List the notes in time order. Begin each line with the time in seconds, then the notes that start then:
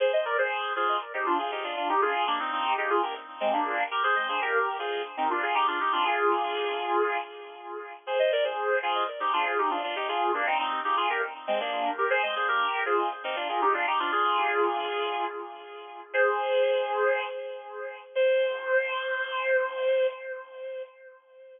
0.00 G#4 C5
0.13 C5 D#5
0.25 A#4 D5
0.38 G#4 C5
0.76 F4 G#4
1.14 D#4 G4
1.26 D4 F4
1.39 F4 G#4
1.51 D#4 G4
1.63 D4 F4
1.76 D4 F4
1.89 D#4 G4
2.01 F4 G#4
2.27 A#3 D4
2.39 C4 D#4
2.52 C4 D#4
2.78 D#4 G4
2.90 F4 G#4
3.03 G4 A#4
3.40 G#3 C4
3.53 A#3 D4
3.91 G4 A#4
4.03 G#4 C5
4.16 C5 D#5
4.29 G#4 C5
4.41 G4 A#4
4.79 F4 G#4
5.17 C4 D#4
5.30 D4 F4
5.42 F4 G#4
5.55 D#4 G4
5.67 D4 F4
5.80 D#4 G4
5.92 D4 F4
6.05 F4 G#4
8.07 G#4 C5
8.19 C5 D#5
8.32 A#4 D5
8.44 G#4 C5
8.82 F4 G#4
9.20 D#4 G4
9.33 D4 F4
9.46 F4 G#4
9.58 D#4 G4
9.70 D4 F4
9.83 D4 F4
9.96 D#4 G4
10.08 F4 G#4
10.34 A#3 D4
10.46 C4 D#4
10.59 C4 D#4
10.84 D#4 G4
10.97 F4 G#4
11.09 G4 A#4
11.47 G#3 C4
11.60 A#3 D4
11.98 G4 A#4
12.10 G#4 C5
12.23 C5 D#5
12.36 G#4 C5
12.48 G4 A#4
12.86 F4 G#4
13.24 C4 D#4
13.36 D4 F4
13.49 F4 G#4
13.61 D#4 G4
13.74 D4 F4
13.87 D#4 G4
13.99 D4 F4
14.12 F4 G#4
16.13 G#4 C5
18.15 C5